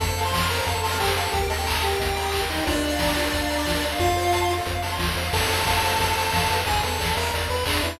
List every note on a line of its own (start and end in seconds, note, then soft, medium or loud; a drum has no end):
0.00 0.61 F2 loud
0.00 0.07 A4 loud
0.00 0.21 A4 medium
0.00 0.21 A5 medium
0.00 kick medium
0.00 closed hi-hat medium
0.08 0.16 C5 medium
0.17 0.24 F5 medium
0.17 open hi-hat medium
0.25 0.46 C5 medium
0.25 0.32 A5 medium
0.25 0.46 C6 medium
0.32 0.41 C6 medium
0.32 kick medium
0.32 snare medium
0.42 0.49 F6 loud
0.50 0.57 A4 medium
0.50 0.66 A#4 medium
0.50 0.66 A#5 medium
0.50 open hi-hat medium
0.58 0.66 C5 medium
0.66 1.28 F2 loud
0.66 0.81 A4 medium
0.66 0.74 F5 medium
0.66 0.81 A5 medium
0.66 kick medium
0.66 closed hi-hat medium
0.75 0.82 A5 medium
0.83 0.98 A4 medium
0.83 0.98 A5 medium
0.83 0.91 C6 medium
0.83 open hi-hat medium
0.92 0.99 F6 medium
1.00 1.13 G4 medium
1.00 1.07 A4 medium
1.00 1.13 G5 medium
1.00 kick medium
1.00 clap loud
1.08 1.16 C5 medium
1.16 1.32 A4 medium
1.16 1.24 F5 medium
1.16 1.32 A5 medium
1.16 snare soft
1.16 open hi-hat medium
1.25 1.32 A5 medium
1.32 1.95 D#2 loud
1.32 1.41 G4 medium
1.32 1.47 G4 medium
1.32 1.47 G5 medium
1.32 kick medium
1.32 closed hi-hat medium
1.42 1.49 A#4 medium
1.50 1.82 A4 medium
1.50 1.57 D#5 medium
1.50 1.82 A5 medium
1.50 open hi-hat medium
1.58 1.66 G5 medium
1.66 1.74 A#5 loud
1.66 kick medium
1.66 clap loud
1.75 1.82 D#6 medium
1.83 2.41 G4 medium
1.83 1.91 G4 medium
1.83 2.41 G5 medium
1.83 open hi-hat medium
1.92 1.99 A#4 medium
2.00 2.61 D#2 medium
2.00 2.07 D#5 medium
2.00 kick medium
2.00 closed hi-hat medium
2.08 2.16 G5 medium
2.16 2.24 A#5 medium
2.16 open hi-hat medium
2.25 2.32 D#6 medium
2.32 2.41 G4 medium
2.32 kick medium
2.32 clap medium
2.42 2.49 A#4 medium
2.50 2.65 D#4 medium
2.50 2.57 D#5 medium
2.50 2.65 D#5 medium
2.50 snare soft
2.50 open hi-hat medium
2.58 2.66 G5 medium
2.67 3.29 D2 loud
2.67 3.85 D4 medium
2.67 2.74 F4 loud
2.67 3.85 D5 medium
2.67 kick medium
2.67 closed hi-hat medium
2.75 2.82 A#4 medium
2.83 2.91 D5 medium
2.83 open hi-hat medium
2.92 2.99 F5 medium
2.99 3.07 A#5 medium
2.99 kick medium
2.99 snare medium
3.08 3.16 D6 medium
3.16 3.24 F4 medium
3.16 open hi-hat medium
3.25 3.32 A#4 medium
3.32 3.95 D2 medium
3.32 3.41 D5 loud
3.32 kick medium
3.32 closed hi-hat medium
3.42 3.49 F5 medium
3.50 3.57 A#5 medium
3.50 open hi-hat medium
3.58 3.66 D6 medium
3.65 3.74 F4 medium
3.65 kick medium
3.65 snare medium
3.75 3.82 A#4 medium
3.82 3.91 D5 medium
3.82 snare soft
3.82 open hi-hat medium
3.92 3.99 F5 medium
3.98 4.61 F2 loud
3.98 4.53 F4 medium
3.98 4.07 F4 loud
3.98 4.53 F5 medium
3.98 kick medium
3.98 closed hi-hat medium
4.08 4.16 A4 medium
4.17 4.24 C5 medium
4.17 open hi-hat medium
4.25 4.32 F5 medium
4.32 4.41 A5 loud
4.32 kick medium
4.32 closed hi-hat medium
4.42 4.49 C6 medium
4.50 4.57 F4 medium
4.50 open hi-hat medium
4.58 4.66 A4 medium
4.66 4.99 F2 medium
4.66 4.74 C5 medium
4.66 kick medium
4.66 closed hi-hat medium
4.75 4.82 F5 medium
4.82 4.91 A5 medium
4.82 open hi-hat medium
4.92 4.99 C6 medium
4.98 5.15 D#2 medium
4.98 5.07 F4 medium
4.98 kick medium
4.98 snare medium
5.08 5.16 A4 medium
5.16 5.31 E2 medium
5.16 5.24 C5 medium
5.16 snare soft
5.16 open hi-hat medium
5.25 5.32 F5 medium
5.33 5.47 F2 loud
5.33 5.48 A4 loud
5.33 6.56 A4 medium
5.33 6.56 A5 medium
5.33 kick medium
5.33 crash loud
5.41 closed hi-hat medium
5.50 5.64 F2 medium
5.50 5.65 C5 medium
5.50 open hi-hat medium
5.58 closed hi-hat medium
5.65 5.81 F2 medium
5.65 5.82 F5 medium
5.65 kick medium
5.65 clap medium
5.75 closed hi-hat medium
5.82 5.97 F2 medium
5.82 5.98 C5 medium
5.82 open hi-hat medium
5.90 closed hi-hat medium
5.99 6.14 F2 medium
5.99 6.15 A4 loud
5.99 kick medium
5.99 closed hi-hat medium
6.08 closed hi-hat medium
6.17 6.31 F2 medium
6.17 6.32 C5 medium
6.17 open hi-hat medium
6.25 closed hi-hat medium
6.33 6.48 F2 medium
6.33 6.48 F5 medium
6.33 kick medium
6.33 snare medium
6.40 closed hi-hat medium
6.50 6.64 F2 medium
6.50 6.65 B4 medium
6.50 open hi-hat medium
6.59 closed hi-hat medium
6.66 6.81 E2 medium
6.66 6.81 G#4 medium
6.66 6.82 G#4 loud
6.66 6.81 G#5 medium
6.66 kick medium
6.66 closed hi-hat medium
6.75 closed hi-hat medium
6.82 6.98 E2 medium
6.82 7.10 A4 medium
6.82 6.98 B4 medium
6.82 7.10 A5 medium
6.82 open hi-hat medium
6.92 closed hi-hat medium
6.99 7.14 E2 medium
6.99 7.15 D5 medium
6.99 kick medium
6.99 snare medium
7.07 closed hi-hat medium
7.17 7.31 E2 medium
7.17 7.31 A#4 medium
7.17 7.32 E5 medium
7.17 7.31 A#5 medium
7.17 open hi-hat medium
7.25 closed hi-hat medium
7.33 7.48 E2 medium
7.33 7.48 D5 loud
7.33 kick medium
7.33 closed hi-hat medium
7.41 closed hi-hat medium
7.50 7.64 E2 medium
7.50 7.65 B4 medium
7.50 7.65 B5 medium
7.50 open hi-hat medium
7.58 closed hi-hat medium
7.66 7.80 E2 medium
7.66 7.83 D4 medium
7.66 7.82 G#4 medium
7.66 7.83 D5 medium
7.66 kick medium
7.66 clap loud
7.74 closed hi-hat medium
7.83 7.97 E2 medium
7.83 7.99 E4 medium
7.83 7.98 B4 medium
7.83 7.99 E5 medium
7.83 open hi-hat medium
7.93 closed hi-hat medium